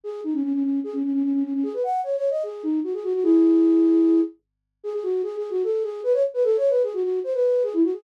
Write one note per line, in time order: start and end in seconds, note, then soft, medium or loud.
0.04 0.21 G#4 medium
0.24 0.34 D#4 medium
0.34 0.43 C#4 medium
0.43 0.53 C#4 medium
0.53 0.63 C#4 medium
0.64 0.80 C#4 medium
0.84 0.93 G#4 medium
0.93 1.03 C#4 medium
1.04 1.12 C#4 medium
1.13 1.23 C#4 medium
1.23 1.33 C#4 medium
1.33 1.43 C#4 medium
1.44 1.53 C#4 medium
1.54 1.63 C#4 medium
1.63 1.73 G#4 medium
1.74 1.83 B4 medium
1.84 2.01 F#5 medium
2.04 2.16 C#5 medium
2.16 2.29 C#5 medium
2.30 2.43 D#5 medium
2.43 2.63 G#4 medium
2.63 2.80 D#4 medium
2.84 2.93 F#4 medium
2.94 3.03 G#4 medium
3.04 3.13 F#4 loud
3.14 3.23 F#4 medium
3.23 4.21 E4 medium
3.23 4.21 G#4 loud
4.84 4.93 G#4 loud
4.94 5.03 G#4 medium
5.03 5.22 F#4 medium
5.23 5.36 G#4 medium
5.37 5.50 G#4 medium
5.50 5.63 F#4 loud
5.64 5.83 A4 medium
5.83 6.01 G#4 medium
6.03 6.13 B4 loud
6.13 6.23 C#5 loud
6.34 6.43 B4 medium
6.44 6.57 A4 loud
6.57 6.70 C#5 loud
6.70 6.82 B4 medium
6.83 6.93 G#4 medium
6.94 7.03 F#4 loud
7.03 7.19 F#4 medium
7.24 7.33 C5 medium
7.34 7.63 B4 medium
7.63 7.73 G#4 loud
7.73 7.83 E4 medium
7.84 7.94 F#4 medium
7.93 8.03 G#4 medium